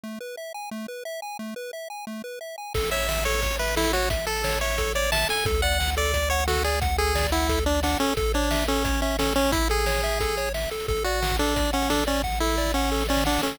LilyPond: <<
  \new Staff \with { instrumentName = "Lead 1 (square)" } { \time 4/4 \key a \major \tempo 4 = 177 r1 | r1 | r8 e''4 cis''4 b'8 e'8 fis'8 | r8 a'4 cis''4 d''8 a''8 gis''8 |
r8 fis''4 d''4 cis''8 fis'8 gis'8 | r8 gis'4 e'4 d'8 d'8 cis'8 | r8 d'4 cis'4 cis'8 cis'8 cis'8 | e'8 gis'2~ gis'8 r4 |
r8 fis'4 d'4 cis'8 d'8 cis'8 | r8 e'4 cis'4 cis'8 d'8 cis'8 | }
  \new Staff \with { instrumentName = "Lead 1 (square)" } { \time 4/4 \key a \major a8 b'8 e''8 gis''8 a8 b'8 e''8 gis''8 | a8 b'8 e''8 gis''8 a8 b'8 e''8 gis''8 | a'8 cis''8 e''8 a'8 cis''8 e''8 a'8 cis''8 | e''8 a'8 cis''8 e''8 a'8 cis''8 e''8 a'8 |
a'8 d''8 fis''8 a'8 d''8 fis''8 a'8 d''8 | fis''8 a'8 d''8 fis''8 a'8 d''8 fis''8 a'8 | a'8 cis''8 e''8 a'8 cis''8 e''8 a'8 cis''8 | e''8 a'8 cis''8 e''8 a'8 cis''8 e''8 a'8 |
a'8 d''8 fis''8 a'8 d''8 fis''8 a'8 d''8 | fis''8 a'8 d''8 fis''8 a'8 d''8 fis''8 a'8 | }
  \new Staff \with { instrumentName = "Synth Bass 1" } { \clef bass \time 4/4 \key a \major r1 | r1 | a,,1~ | a,,1 |
d,1~ | d,1 | a,,1~ | a,,1 |
a,,1~ | a,,1 | }
  \new DrumStaff \with { instrumentName = "Drums" } \drummode { \time 4/4 r4 r4 r4 r4 | r4 r4 r4 r4 | <cymc bd>16 hh16 hh16 hh16 sn16 hh16 hh16 hh16 <hh bd>16 hh16 hh16 hh16 sn16 hh16 hh16 hh16 | <hh bd>8 hh16 hh16 sn16 hh16 hh16 hh16 <hh bd>16 hh16 hh16 hh16 sn16 hh16 hh16 hh16 |
<hh bd>16 hh16 hh16 hh16 sn16 hh16 hh16 hh16 <hh bd>16 hh16 hh16 hh16 sn16 hh16 hh16 hh16 | <hh bd>16 hh16 hh16 hh16 sn16 <hh bd>16 hh16 hh16 <hh bd>16 hh16 hh16 hh16 sn16 hh16 hh16 hh16 | <hh bd>16 hh16 hh16 hh16 sn16 hh16 hh16 hh16 <hh bd>16 hh16 hh16 hh16 sn16 hh16 hh16 hh16 | <hh bd>16 hh16 hh16 hh16 sn16 hh16 hh16 hh16 <hh bd>16 hh16 hh16 hh16 sn16 hh16 hh16 hho16 |
<hh bd>16 hh16 hh16 hh16 sn16 <hh bd>16 hh16 hh16 <hh bd>16 hh16 hh16 hh16 sn16 hh16 hh16 hh16 | <bd sn>16 sn16 sn16 sn16 sn16 sn16 sn16 sn16 sn32 sn32 sn32 sn32 sn32 sn32 sn32 sn32 sn32 sn32 sn32 sn32 sn32 sn32 sn32 sn32 | }
>>